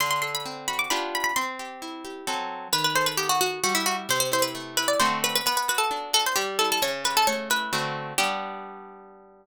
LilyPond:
<<
  \new Staff \with { instrumentName = "Harpsichord" } { \time 3/4 \key g \major \tempo 4 = 132 c'''16 c'''16 c'''16 b''8. b''16 d'''16 b''8 b''16 b''16 | c'''2~ c'''8 r8 | b'16 b'16 c''16 b'16 g'16 fis'16 fis'8 fis'16 e'16 fis'16 r16 | c''16 c''16 c''16 b'8. b'16 d''16 c''8 b'16 b'16 |
b'16 b'16 b'16 a'8. a'16 c''16 g'8 a'16 a'16 | cis''8 b'16 a'16 cis''8 b'4 r8 | g'2. | }
  \new Staff \with { instrumentName = "Acoustic Guitar (steel)" } { \time 3/4 \key g \major d8 a'8 c'8 fis'8 <b d' f' g'>4 | c'8 g'8 e'8 g'8 <fis c' a'>4 | dis8 a'8 b8 fis'8 g8 e'8 | c8 e'8 a8 e'8 <d a c' fis'>4 |
b8 fis'8 d'8 fis'8 g8 e'8 | cis8 g'8 a8 e'8 <d a c' fis'>4 | <g b d'>2. | }
>>